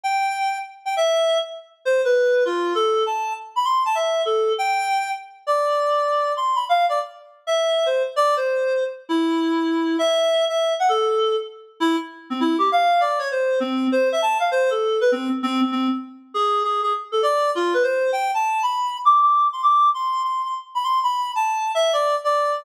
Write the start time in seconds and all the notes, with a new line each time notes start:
0.04 G5
0.85 G5
0.97 E5
1.85 C5
2.05 B4
2.45 F4
2.75 A4
3.06 A5
3.56 B5
3.65 C6
3.85 A5
3.95 E5
4.25 A4
4.58 G5
5.47 D5
6.37 C6
6.55 B5
6.69 F5
6.89 D5
7.47 E5
7.86 C5
8.16 D5
8.37 C5
9.09 E4
9.99 E5
10.49 E5
10.80 F#5
10.89 A4
11.80 E4
12.30 C4
12.40 E4
12.58 G4
12.72 F5
13.00 D5
13.19 C#5
13.31 C5
13.60 C4
13.92 C5
14.12 E5
14.22 A5
14.40 F5
14.51 C5
14.70 A4
15.01 B4
15.12 C4
15.43 C4
15.61 C4
15.72 C4
16.34 G#4
16.64 G#4
16.83 G#4
17.12 A4
17.23 D5
17.55 F4
17.74 B4
17.83 C5
18.13 G5
18.34 A5
18.63 B5
19.05 D6
19.21 D6
19.53 C6
19.63 D6
19.94 C6
20.24 C6
20.45 C6
20.75 B5
20.84 C6
21.03 B5
21.35 A5
21.75 E5
21.93 D5
22.24 D5